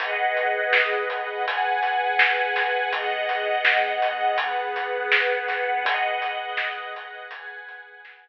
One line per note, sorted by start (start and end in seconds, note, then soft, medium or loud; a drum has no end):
0.00 1.45 G#4 medium
0.00 1.45 B4 medium
0.00 1.45 D#5 medium
0.00 1.45 F#5 medium
0.00 kick loud
0.00 closed hi-hat loud
0.37 closed hi-hat medium
0.73 snare loud
1.09 kick medium
1.09 closed hi-hat medium
1.46 2.91 G#4 medium
1.46 2.91 B4 medium
1.46 2.91 F#5 medium
1.46 2.91 G#5 medium
1.46 kick medium
1.46 closed hi-hat loud
1.83 closed hi-hat medium
2.19 snare loud
2.56 snare medium
2.56 closed hi-hat medium
2.93 4.37 B3 medium
2.93 4.37 G#4 medium
2.93 4.37 D#5 medium
2.93 4.37 F#5 medium
2.93 kick loud
2.93 closed hi-hat loud
3.29 closed hi-hat medium
3.65 snare loud
4.02 closed hi-hat medium
4.38 5.84 B3 medium
4.38 5.83 G#4 medium
4.38 5.83 B4 medium
4.38 5.83 F#5 medium
4.38 kick loud
4.38 closed hi-hat loud
4.76 closed hi-hat medium
5.12 snare loud
5.48 kick loud
5.48 snare medium
5.48 closed hi-hat medium
5.84 7.29 G#4 medium
5.84 7.29 B4 medium
5.84 7.29 D#5 medium
5.84 7.29 F#5 medium
5.84 kick loud
5.84 closed hi-hat loud
6.22 closed hi-hat medium
6.57 snare loud
6.95 kick medium
6.95 closed hi-hat medium
7.31 8.28 G#4 medium
7.31 8.28 B4 medium
7.31 8.28 F#5 medium
7.31 8.28 G#5 medium
7.31 kick medium
7.31 closed hi-hat loud
7.69 closed hi-hat medium
8.05 snare loud